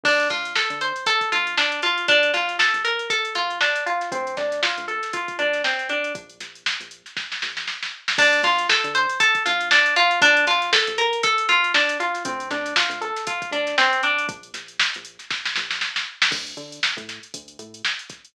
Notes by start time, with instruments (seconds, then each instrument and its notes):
0.03 synth bass 1 D2, acoustic guitar (steel) D4, kick, crash
0.20 snare, closed hi-hat
0.30 synth bass 1 D2, acoustic guitar (steel) F4, kick, snare, closed hi-hat
0.45 closed hi-hat
0.56 acoustic guitar (steel) A4, snare
0.70 synth bass 1 D3, closed hi-hat
0.81 acoustic guitar (steel) C5, closed hi-hat
0.96 closed hi-hat
1.06 acoustic guitar (steel) A4, kick, closed hi-hat
1.21 kick, closed hi-hat
1.32 synth bass 1 D2, acoustic guitar (steel) F4, closed hi-hat
1.47 closed hi-hat
1.58 acoustic guitar (steel) D4, snare
1.72 closed hi-hat
1.82 acoustic guitar (steel) F4, closed hi-hat
1.98 closed hi-hat
2.08 synth bass 1 A#1, acoustic guitar (steel) D4, kick, closed hi-hat
2.23 closed hi-hat
2.34 synth bass 1 A#1, acoustic guitar (steel) F4, snare, closed hi-hat
2.48 snare, closed hi-hat
2.59 acoustic guitar (steel) A4, snare
2.74 synth bass 1 A#1, closed hi-hat
2.85 acoustic guitar (steel) A#4, closed hi-hat
2.99 closed hi-hat
3.10 acoustic guitar (steel) A4, kick, closed hi-hat
3.25 closed hi-hat
3.35 synth bass 1 A#1, acoustic guitar (steel) F4, closed hi-hat
3.50 closed hi-hat
3.61 acoustic guitar (steel) D4, snare
3.75 snare, closed hi-hat
3.86 acoustic guitar (steel) F4, closed hi-hat
4.01 snare, closed hi-hat
4.12 synth bass 1 D2, acoustic guitar (steel) C4, kick, closed hi-hat
4.27 closed hi-hat
4.37 synth bass 1 D2, acoustic guitar (steel) D4, kick, snare, closed hi-hat
4.52 snare, closed hi-hat
4.63 acoustic guitar (steel) F4, snare
4.77 synth bass 1 D2, closed hi-hat
4.88 acoustic guitar (steel) A4, closed hi-hat
5.03 snare, closed hi-hat
5.13 acoustic guitar (steel) F4, kick, closed hi-hat
5.28 kick, closed hi-hat
5.39 synth bass 1 D2, acoustic guitar (steel) D4, closed hi-hat
5.53 snare, closed hi-hat
5.64 acoustic guitar (steel) C4, snare
5.79 closed hi-hat
5.89 acoustic guitar (steel) D4, closed hi-hat
6.04 closed hi-hat
6.15 synth bass 1 A#1, kick, closed hi-hat
6.30 closed hi-hat
6.40 synth bass 1 A#1, snare, closed hi-hat
6.55 closed hi-hat
6.66 snare
6.80 synth bass 1 A#1, closed hi-hat
6.91 closed hi-hat
7.06 snare, closed hi-hat
7.17 kick, snare
7.32 snare
7.42 synth bass 1 A#1, snare
7.57 snare
7.68 snare
7.83 snare
8.08 snare
8.18 synth bass 1 D2, acoustic guitar (steel) D4, kick, crash
8.33 snare, closed hi-hat
8.43 synth bass 1 D2, acoustic guitar (steel) F4, kick, snare, closed hi-hat
8.59 closed hi-hat
8.69 acoustic guitar (steel) A4, snare
8.84 synth bass 1 D3, closed hi-hat
8.95 acoustic guitar (steel) C5, closed hi-hat
9.10 closed hi-hat
9.20 acoustic guitar (steel) A4, kick, closed hi-hat
9.35 kick, closed hi-hat
9.46 synth bass 1 D2, acoustic guitar (steel) F4, closed hi-hat
9.61 closed hi-hat
9.71 acoustic guitar (steel) D4, snare
9.86 closed hi-hat
9.96 acoustic guitar (steel) F4, closed hi-hat
10.11 closed hi-hat
10.22 synth bass 1 A#1, acoustic guitar (steel) D4, kick, closed hi-hat
10.37 closed hi-hat
10.47 synth bass 1 A#1, acoustic guitar (steel) F4, snare, closed hi-hat
10.62 snare, closed hi-hat
10.73 acoustic guitar (steel) A4, snare
10.87 synth bass 1 A#1, closed hi-hat
10.98 acoustic guitar (steel) A#4, closed hi-hat
11.13 closed hi-hat
11.23 acoustic guitar (steel) A4, kick, closed hi-hat
11.38 closed hi-hat
11.49 synth bass 1 A#1, acoustic guitar (steel) F4, closed hi-hat
11.64 closed hi-hat
11.74 acoustic guitar (steel) D4, snare
11.89 snare, closed hi-hat
12.00 acoustic guitar (steel) F4, closed hi-hat
12.14 snare, closed hi-hat
12.25 synth bass 1 D2, acoustic guitar (steel) C4, kick, closed hi-hat
12.40 closed hi-hat
12.51 synth bass 1 D2, acoustic guitar (steel) D4, kick, snare, closed hi-hat
12.66 snare, closed hi-hat
12.76 acoustic guitar (steel) F4, snare
12.89 synth bass 1 D2, closed hi-hat
13.01 acoustic guitar (steel) A4, closed hi-hat
13.17 snare, closed hi-hat
13.27 acoustic guitar (steel) F4, kick, closed hi-hat
13.42 kick, closed hi-hat
13.51 synth bass 1 D2, acoustic guitar (steel) D4, closed hi-hat
13.67 snare, closed hi-hat
13.78 acoustic guitar (steel) C4, snare
13.93 closed hi-hat
14.03 acoustic guitar (steel) D4, closed hi-hat
14.19 closed hi-hat
14.28 synth bass 1 A#1, kick, closed hi-hat
14.43 closed hi-hat
14.54 synth bass 1 A#1, snare, closed hi-hat
14.68 closed hi-hat
14.80 snare
14.94 synth bass 1 A#1, closed hi-hat
15.05 closed hi-hat
15.19 snare, closed hi-hat
15.31 kick, snare
15.45 snare
15.56 synth bass 1 A#1, snare
15.71 snare
15.81 snare
15.96 snare
16.22 snare
16.31 synth bass 1 D2, kick, crash
16.47 closed hi-hat
16.57 synth bass 1 D3, closed hi-hat
16.72 closed hi-hat
16.83 snare
16.97 synth bass 1 A2, kick, closed hi-hat
17.09 snare, closed hi-hat
17.23 closed hi-hat
17.34 synth bass 1 D2, kick, closed hi-hat
17.48 closed hi-hat
17.59 synth bass 1 A2, closed hi-hat
17.74 closed hi-hat
17.85 snare
17.99 closed hi-hat
18.10 kick, snare, closed hi-hat
18.25 closed hi-hat